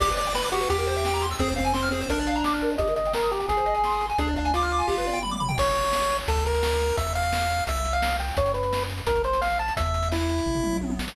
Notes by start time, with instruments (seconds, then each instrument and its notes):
0.00 synth bass 1 G1, lead 1 (square) G4 D5, kick, crash
0.09 lead 1 (square) B4, kick, closed hi-hat
0.17 lead 1 (square) D5, closed hi-hat
0.26 lead 1 (square) G5, closed hi-hat
0.34 lead 1 (square) B4 B5, snare
0.44 lead 1 (square) D6, closed hi-hat
0.52 lead 1 (square) F#4 G4, closed hi-hat
0.60 lead 1 (square) B4, snare, closed hi-hat
0.69 synth bass 1 E2, lead 1 (square) G4, kick, closed hi-hat
0.78 lead 1 (square) A#4, closed hi-hat
0.87 lead 1 (square) C5, closed hi-hat
0.96 lead 1 (square) E5, closed hi-hat
1.05 lead 1 (square) G5, snare
1.13 lead 1 (square) A#5, closed hi-hat
1.22 lead 1 (square) C6, closed hi-hat
1.31 lead 1 (square) E6, open hi-hat
1.39 synth bass 1 F2, lead 1 (square) C4 G#4, kick, closed hi-hat
1.48 lead 1 (square) C5, kick, closed hi-hat
1.56 lead 1 (square) C4 F5, kick, closed hi-hat
1.64 lead 1 (square) G#5, closed hi-hat
1.73 lead 1 (square) C4 C6, snare
1.82 lead 1 (square) F6, closed hi-hat
1.91 lead 1 (square) C4 G#4, closed hi-hat
2.01 lead 1 (square) C5, snare, closed hi-hat
2.09 synth bass 1 A#1, lead 1 (square) D4 A#4, kick, closed hi-hat
2.18 lead 1 (square) D5, closed hi-hat
2.27 lead 1 (square) F5, closed hi-hat
2.35 lead 1 (square) A#5, closed hi-hat
2.44 synth bass 1 A1, lead 1 (square) D6, snare
2.53 lead 1 (square) F6, closed hi-hat
2.61 synth bass 1 G#1, lead 1 (square) A#4, closed hi-hat
2.70 lead 1 (square) D5, closed hi-hat
2.78 synth bass 1 G1, lead 1 (square) G4 D#5, kick, closed hi-hat
2.88 lead 1 (square) A#4, closed hi-hat
2.96 lead 1 (square) D#5, closed hi-hat
3.05 lead 1 (square) G5, closed hi-hat
3.13 lead 1 (square) A#4 A#5, snare
3.22 lead 1 (square) D#6, closed hi-hat
3.30 lead 1 (square) G4 A#5, closed hi-hat
3.39 lead 1 (square) G5, snare, closed hi-hat
3.48 synth bass 1 G#1, lead 1 (square) G#4, kick, closed hi-hat
3.57 lead 1 (square) C5, closed hi-hat
3.66 lead 1 (square) D#5, closed hi-hat
3.74 lead 1 (square) G#5, closed hi-hat
3.84 lead 1 (square) C6, snare
3.91 lead 1 (square) D#6, closed hi-hat
4.00 lead 1 (square) C6, closed hi-hat
4.09 lead 1 (square) G#5, closed hi-hat
4.18 synth bass 1 D2, lead 1 (square) D4 G#4, kick, closed hi-hat
4.27 lead 1 (square) D5, kick, closed hi-hat
4.36 lead 1 (square) D4 F5, kick, closed hi-hat
4.45 lead 1 (square) G#5, closed hi-hat
4.54 lead 1 (square) F4 D6, snare
4.62 lead 1 (square) F6, closed hi-hat
4.71 lead 1 (square) D6, closed hi-hat
4.78 lead 1 (square) G#5, snare, closed hi-hat
4.87 synth bass 1 G1, lead 1 (square) G4, kick, snare
4.97 lead 1 (square) B4, snare
5.06 lead 1 (square) D5, high tom
5.13 lead 1 (square) G5
5.23 lead 1 (square) B5, mid tom
5.31 lead 1 (square) D6, mid tom
5.40 lead 1 (square) B5, floor tom
5.48 lead 1 (square) G5, floor tom
5.58 synth bass 1 A1, lead 1 (square) C#5, kick, crash
5.67 closed hi-hat
5.75 closed hi-hat
5.84 closed hi-hat
5.93 snare
6.01 closed hi-hat
6.10 closed hi-hat
6.19 closed hi-hat
6.28 synth bass 1 D2, lead 1 (square) A4, kick, closed hi-hat
6.36 kick, closed hi-hat
6.45 lead 1 (square) A#4, closed hi-hat
6.54 closed hi-hat
6.63 snare
6.72 closed hi-hat
6.81 closed hi-hat
6.89 closed hi-hat
6.97 synth bass 1 E2, lead 1 (square) E5, kick, closed hi-hat
7.07 closed hi-hat
7.15 lead 1 (square) F5, closed hi-hat
7.23 closed hi-hat
7.33 snare
7.41 closed hi-hat
7.50 closed hi-hat
7.59 closed hi-hat
7.67 synth bass 1 C2, lead 1 (square) E5, kick, closed hi-hat
7.76 closed hi-hat
7.85 closed hi-hat
7.93 lead 1 (square) F5, closed hi-hat
8.02 snare
8.10 closed hi-hat
8.20 lead 1 (square) G5, closed hi-hat
8.28 open hi-hat
8.37 synth bass 1 F#2, lead 1 (square) C#5, kick, closed hi-hat
8.46 closed hi-hat
8.54 lead 1 (square) B4, closed hi-hat
8.63 closed hi-hat
8.73 snare
8.81 closed hi-hat
8.90 closed hi-hat
8.98 closed hi-hat
9.07 synth bass 1 A#1, lead 1 (square) A#4, kick, closed hi-hat
9.15 kick, closed hi-hat
9.24 lead 1 (square) C5, closed hi-hat
9.33 closed hi-hat
9.41 lead 1 (square) F5, snare
9.50 closed hi-hat
9.59 lead 1 (square) A5, closed hi-hat
9.68 closed hi-hat
9.77 synth bass 1 E2, lead 1 (square) E5, kick, closed hi-hat
9.86 closed hi-hat
9.94 closed hi-hat
10.03 closed hi-hat
10.12 lead 1 (square) E4, snare
10.20 closed hi-hat
10.29 closed hi-hat
10.38 closed hi-hat
10.46 synth bass 1 A1, kick, floor tom
10.55 floor tom
10.64 mid tom
10.73 mid tom
10.81 synth bass 1 A#1, high tom
10.90 high tom
10.99 synth bass 1 A1, snare
11.08 snare